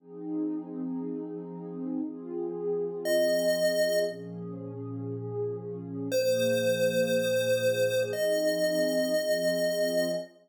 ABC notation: X:1
M:4/4
L:1/8
Q:1/4=118
K:Fm
V:1 name="Lead 1 (square)"
z8 | z4 e4 | z8 | c8 |
e8 |]
V:2 name="Pad 2 (warm)"
[F,CEA]8 | [F,CFA]8 | [B,,F,DA]8 | [B,,F,B,A]8 |
[F,CEA]4 [F,CFA]4 |]